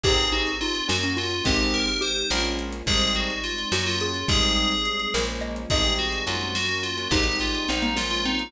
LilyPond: <<
  \new Staff \with { instrumentName = "Tubular Bells" } { \time 5/8 \key aes \mixolydian \tempo 4 = 106 aes'8 ges'8 f'8 ges'16 ges'16 f'8 | g'8 bes'8 c''8 bes'16 r8. | aes'8 ges'8 f'8 ges'16 f'16 f'8 | aes'4. r4 |
aes'8 ges'8 f'8 ges'16 ges'16 f'8 | g'8 f'8 ees'8 f'16 f'16 ees'8 | }
  \new Staff \with { instrumentName = "Xylophone" } { \time 5/8 \key aes \mixolydian g'8 ees'8 ees'8 des'16 des'16 f'8 | c'4 g'8 r4 | r4. ges'16 r16 aes'8 | r4. bes'16 r16 ees''8 |
ees''4 r4. | ees'16 r8. c'16 bes16 bes8 c'8 | }
  \new Staff \with { instrumentName = "Acoustic Grand Piano" } { \time 5/8 \key aes \mixolydian <c' ees' g' aes'>4. <bes des' ges'>4 | <aes c' ees' g'>4. <aes bes des' f'>4 | <g aes c' ees'>4. <ges bes des'>4 | <g aes c' ees'>4. <f aes bes des'>4 |
<c' ees' g' aes'>16 <c' ees' g' aes'>8. <bes des' ges'>4~ <bes des' ges'>16 <bes des' ges'>16 | <aes c' ees' g'>16 <aes c' ees' g'>4~ <aes c' ees' g'>16 <aes bes des' f'>8. <aes bes des' f'>16 | }
  \new Staff \with { instrumentName = "Electric Bass (finger)" } { \clef bass \time 5/8 \key aes \mixolydian aes,,4. ges,4 | aes,,4. bes,,4 | aes,,4. ges,4 | aes,,4. bes,,4 |
aes,,4 ges,4. | aes,,4 bes,,4. | }
  \new Staff \with { instrumentName = "String Ensemble 1" } { \time 5/8 \key aes \mixolydian <c' ees' g' aes'>4. <bes des' ges'>4 | <aes c' ees' g'>4. <aes bes des' f'>4 | <g aes c' ees'>4. <ges bes des'>4 | <g aes c' ees'>4. <f aes bes des'>4 |
<ees g aes c'>4. <ges bes des'>4 | <g aes c' ees'>4. <f aes bes des'>4 | }
  \new DrumStaff \with { instrumentName = "Drums" } \drummode { \time 5/8 <cymc bd>16 hh16 hh16 hh16 hh16 hh16 sn16 hh16 hh16 hh16 | <hh bd>16 hh16 hh16 hh16 hh16 hh16 sn16 hh16 hh16 hh16 | <hh bd>16 hh16 hh16 hh16 hh16 hh16 sn16 hh16 hh16 hh16 | <hh bd>16 hh16 hh16 hh16 hh16 hh16 sn16 hh16 hh16 hh16 |
<hh bd>16 hh16 hh16 hh16 hh16 hh16 sn16 hh16 hh16 hh16 | <hh bd>16 hh16 hh16 hh16 hh16 hh16 sn16 hh16 hh16 hh16 | }
>>